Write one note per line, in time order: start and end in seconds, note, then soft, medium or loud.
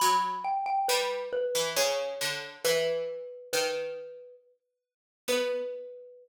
0.00 0.75 F#3 loud
0.00 0.40 B5 loud
0.44 0.65 G5 medium
0.66 0.87 G5 loud
0.88 1.52 G3 loud
0.88 1.28 B4 medium
1.33 1.69 B4 medium
1.55 1.76 E3 loud
1.76 2.15 C#3 loud
1.76 2.50 C#5 medium
2.21 2.64 D3 loud
2.65 3.48 E3 loud
2.65 3.49 B4 loud
3.53 4.66 D#3 loud
3.53 4.35 B4 medium
5.28 6.28 B3 loud
5.28 6.28 B4 loud